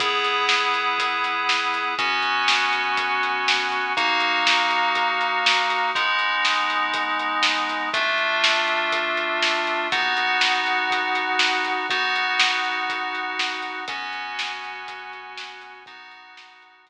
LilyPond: <<
  \new Staff \with { instrumentName = "Electric Piano 2" } { \time 4/4 \key b \major \tempo 4 = 121 <b e' gis'>1 | <b cis' fis'>1 | <ais dis' fis'>1 | <gis b dis'>1 |
<a d' f'>1 | <b dis' fis'>1 | <b dis' fis'>1 | <b cis' fis'>1 |
<b dis' fis'>1 | }
  \new Staff \with { instrumentName = "Synth Bass 1" } { \clef bass \time 4/4 \key b \major e,1 | fis,1 | dis,1 | gis,,1 |
d,1 | dis,1 | b,,1 | fis,1 |
b,,1 | }
  \new DrumStaff \with { instrumentName = "Drums" } \drummode { \time 4/4 <hh bd>8 hh8 sn8 hh8 <hh bd>8 hh8 sn8 hh8 | <hh bd>8 hh8 sn8 hh8 <hh bd>8 hh8 sn8 hh8 | <hh bd>8 hh8 sn8 hh8 <hh bd>8 hh8 sn8 hh8 | <hh bd>8 hh8 sn8 hh8 <hh bd>8 hh8 sn8 hh8 |
<hh bd>8 hh8 sn8 hh8 <hh bd>8 hh8 sn8 hh8 | <hh bd>8 hh8 sn8 hh8 <hh bd>8 hh8 sn8 hh8 | <hh bd>8 hh8 sn8 hh8 <hh bd>8 hh8 sn8 hh8 | <hh bd>8 hh8 sn8 hh8 <hh bd>8 hh8 sn8 hh8 |
<hh bd>8 hh8 sn8 hh8 <hh bd>4 r4 | }
>>